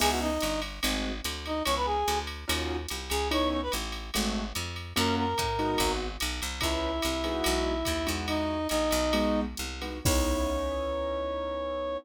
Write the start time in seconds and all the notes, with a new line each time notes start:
0.00 C#2 B3 C#4 D#4 E4 G#4 G#5, crash, ride
0.10 F#4 F#5
0.21 D#4 D#5
0.41 G1, hi-hat pedal, ride
0.62 ride
0.83 G#1 G#3 A3 C4 F#4, ride
1.24 D2, hi-hat pedal, ride
1.46 D#4 D#5, ride
1.65 C#2 B3 C#4 D#4 E4 C#5 C#6, ride
1.77 B4 B5
1.86 G#4 G#5
2.08 D2, hi-hat pedal, ride
2.27 ride
2.48 D#2 C#4 D#4 F4 F#4, ride
2.89 C2, hi-hat pedal, ride
3.10 C#2 G#4 G#5, ride
3.31 B3 C#4 D#4 E4 C#5 C#6, ride
3.51 C#5 C#6
3.62 B4 B5
3.72 A1, hi-hat pedal, ride
3.92 ride
4.14 G#1 G#3 A3 C4 F#4, ride
4.55 F2, hi-hat pedal, ride
4.76 ride
4.96 F#2 A#3 C#4 F4 F#4 A#4 A#5, ride
5.17 A#4 A#5
5.38 A2, kick, hi-hat pedal, ride
5.59 G#3 B3 D#4 F#4, ride
5.78 G#1, kick, ride
6.20 B1, hi-hat pedal, ride
6.42 C2, ride
6.61 C#2 B3 C#4 D#4 E4 E5, kick, ride
7.02 C2, hi-hat pedal, ride
7.24 G#3 B3 D#4 F#4, ride
7.44 B1, ride
7.85 D#2, kick, hi-hat pedal, ride
8.07 E2 G#3 D#4 E4 F#4, ride
8.28 D#4 D#5, ride
8.69 A#1 D#4 D#5, hi-hat pedal, ride
8.91 B1, ride
9.13 G#3 B3 D#4 F#4, ride
9.57 C2, hi-hat pedal
9.81 G#3 B3 D#4 F#4, ride
10.05 C#2 B3 C#4 D#4 E4 C#5, kick, crash